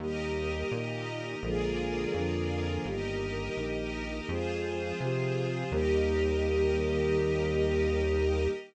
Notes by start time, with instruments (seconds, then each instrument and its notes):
0.00 synth bass 1 D#2, choir aahs D#3 G3 A#3, string ensemble 1 G4 A#4 D#5
0.71 synth bass 1 A#2, choir aahs D#3 A#3 D#4
1.43 synth bass 1 A#1, choir aahs D3 F3 G#3 A#3, string ensemble 1 F4 G#4 A#4 D5
2.14 synth bass 1 F2, choir aahs D3 F3 A#3 D4
2.85 synth bass 1 G1, choir aahs D#3 G3 A#3, string ensemble 1 G4 A#4 D#5
3.57 synth bass 1 A#1, choir aahs D#3 A#3 D#4
4.28 synth bass 1 F2, choir aahs F3 G#3 C4, string ensemble 1 F4 G#4 C5
5.00 synth bass 1 C3, choir aahs C3 F3 C4
5.71 synth bass 1 D#2, choir aahs D#3 G3 A#3, string ensemble 1 G4 A#4 D#5